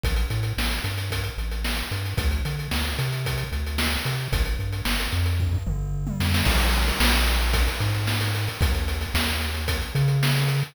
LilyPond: <<
  \new Staff \with { instrumentName = "Synth Bass 1" } { \clef bass \time 4/4 \key c \major \tempo 4 = 112 a,,8 a,8 a,,8 g,4 a,,4 g,8 | d,8 d8 d,8 c4 d,4 c8 | g,,8 g,8 g,,8 f,4 g,,4 f,8 | \key c \minor bes,,4 bes,,4. aes,4. |
ees,4 ees,4. des4. | }
  \new DrumStaff \with { instrumentName = "Drums" } \drummode { \time 4/4 <hh bd>16 hh16 hh16 hh16 sn16 hh16 hh16 hh16 <hh bd>16 hh16 hh16 hh16 sn16 hh16 hh16 hh16 | <hh bd>16 hh16 hh16 hh16 sn16 hh16 hh16 hh16 <hh bd>16 hh16 hh16 hh16 sn16 hh16 hh16 hh16 | <hh bd>16 hh16 hh16 hh16 sn16 hh16 hh16 hh16 <bd tomfh>16 tomfh16 toml8 r16 tommh16 sn16 sn16 | <cymc bd>16 hh16 hh16 hh16 sn16 hh16 hh16 hh16 <hh bd>16 hh16 hh16 hh16 sn16 hh16 hh16 hh16 |
<hh bd>16 hh16 hh16 hh16 sn16 hh16 hh16 hh16 <hh bd>16 hh16 hh16 hh16 sn16 hh16 hh16 hh16 | }
>>